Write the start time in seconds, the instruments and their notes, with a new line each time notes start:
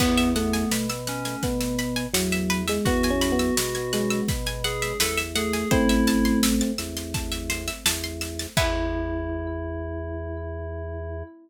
0.00 drawbar organ E2, electric piano 2 B3, electric piano 1 B3, pizzicato strings B4, kick, snare, crash
0.18 pizzicato strings E5, snare
0.35 electric piano 1 A3, electric piano 2 B3, pizzicato strings F#5, snare
0.53 pizzicato strings G#5, snare
0.71 drawbar organ B2, pizzicato strings B5, snare
0.89 pizzicato strings E6, snare
1.07 electric piano 2 C#4, pizzicato strings F#6, snare
1.25 pizzicato strings G#6, snare
1.43 drawbar organ B2, electric piano 1 B3, pizzicato strings F#6, kick, snare
1.61 pizzicato strings E6, snare
1.79 pizzicato strings B5, snare
1.96 pizzicato strings G#5, snare
2.14 drawbar organ E2, electric piano 1 F#3, pizzicato strings F#5, snare
2.32 pizzicato strings E5, snare
2.50 pizzicato strings B4, snare
2.68 electric piano 1 G#3, pizzicato strings E5, snare
2.85 drawbar organ E2, electric piano 1 B3, electric piano 2 F#4, pizzicato strings F#5, kick, snare
3.03 pizzicato strings G#5, snare
3.10 electric piano 1 C#4
3.21 pizzicato strings B5, snare
3.32 electric piano 1 B3
3.39 pizzicato strings E6, snare
3.57 drawbar organ B2, pizzicato strings F#6, snare
3.75 pizzicato strings G#6, snare
3.93 electric piano 1 G#3, pizzicato strings F#6, snare
4.10 pizzicato strings E6, snare
4.28 drawbar organ B2, pizzicato strings B5, kick, snare
4.46 pizzicato strings G#5, snare
4.64 electric piano 2 G#4, pizzicato strings F#5, snare
4.82 pizzicato strings E5, snare
5.00 drawbar organ E2, electric piano 2 A4, pizzicato strings B4, snare
5.17 pizzicato strings E5, snare
5.35 electric piano 1 A3, electric piano 2 G#4, pizzicato strings F#5, snare
5.53 pizzicato strings G#5, snare
5.71 drawbar organ A1, electric piano 1 A3 C4, electric piano 2 E4, pizzicato strings C5, kick, snare
5.89 pizzicato strings E5, snare
6.07 pizzicato strings A5, snare
6.25 pizzicato strings C6, snare
6.43 pizzicato strings E6, snare
6.61 pizzicato strings A6, snare
6.78 drawbar organ E2, pizzicato strings E6, snare
6.97 pizzicato strings C6, snare
7.14 pizzicato strings A5, kick, snare
7.32 pizzicato strings E5, snare
7.50 pizzicato strings C5, snare
7.68 pizzicato strings E5, snare
7.86 drawbar organ E2, pizzicato strings A5, snare
8.04 pizzicato strings C6, snare
8.21 pizzicato strings E6, snare
8.39 pizzicato strings A6, snare
8.57 drawbar organ E2, electric piano 1 E4, electric piano 2 E4, pizzicato strings B4 E5 F#5 G#5, kick, crash